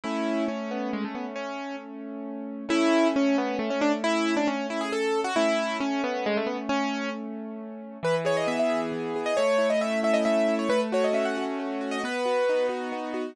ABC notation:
X:1
M:3/4
L:1/16
Q:1/4=135
K:A
V:1 name="Acoustic Grand Piano"
E4 C2 B,2 G, A, B, z | C4 z8 | E4 C2 B,2 A, C D z | E3 D C2 E G A3 F |
E4 C2 B,2 G, A, B, z | C4 z8 | [K:E] B z c d e e2 z4 d | c3 d e2 e d e3 c |
B z c d e f2 z4 d | B6 z6 |]
V:2 name="Acoustic Grand Piano"
[A,C]12- | [A,C]12 | [A,C]12- | [A,C]12 |
[A,C]12- | [A,C]12 | [K:E] E,2 G2 B,2 G2 E,2 G2 | A,2 E2 C2 E2 A,2 E2 |
A,2 F2 C2 F2 A,2 F2 | B,2 F2 D2 F2 B,2 F2 |]